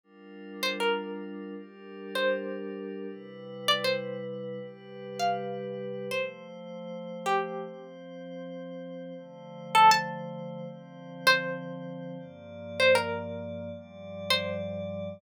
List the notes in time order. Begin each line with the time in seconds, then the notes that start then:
0.03 G3 D4 F4 A#4
0.63 C5
0.80 A#4
1.56 G3 D4 G4 A#4
2.15 C5
3.08 C3 G3 E4 B4
3.68 D5
3.84 C5
4.59 C3 G3 G4 B4
5.19 F5
6.11 F3 A3 C5
7.26 G4
7.63 F3 C4 C5
9.16 D3 F3 A3 C5
9.75 A4
9.91 A5
10.66 D3 F3 C4 C5
11.27 C5
12.18 G2 F3 A#3 D5
12.80 C5
12.95 A#4
13.73 G2 F3 G3 D5
14.30 C5